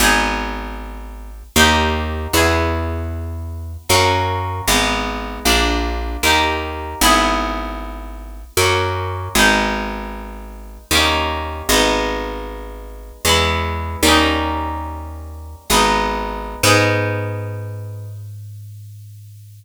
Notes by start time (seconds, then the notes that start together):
0.00 G#1 B3 D#4 G#4
1.56 D#2 A#3 D#4 G4
2.33 E2 B3 E4 G#4
3.89 F#2 A#3 C#4 F#4
4.68 G#1 G#3 B3 D#4
5.45 A#1 A#3 D4 F4
6.23 D#2 A#3 D#4 G4
7.01 G#1 B3 E4 G#4
8.57 F#2 A#3 C#4 F#4
9.35 G#1 G#3 B3 D#4
10.91 D#2 G3 A#3
10.95 C#4 D#4
11.69 G#1 G#3 B3
11.73 D#4
13.25 E2 G#3 B3
13.29 E4
14.03 D#2 G3 A#3
14.07 C#4 D#4
15.70 G#1 G#3 B3 D#4
16.63 G#2 B3 D#4 G#4